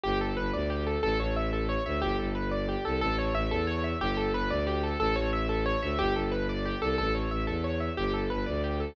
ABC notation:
X:1
M:6/8
L:1/8
Q:3/8=121
K:Amix
V:1 name="Acoustic Grand Piano"
G A B d G A | A c e A c e | G A B d G A | A c e A c e |
G A B d G A | A c e A c e | G A B d G A | A c e A c e |
G A B d G A |]
V:2 name="Violin" clef=bass
G,,,2 G,,, D,,3 | A,,, A,,,4 D,, | G,,, G,,,4 =C,, | A,,,2 A,,, E,,3 |
G,,,2 G,,, D,,3 | A,,, A,,,4 D,, | G,,, G,,,4 =C,, | A,,,2 A,,, E,,3 |
G,,,2 G,,, D,,3 |]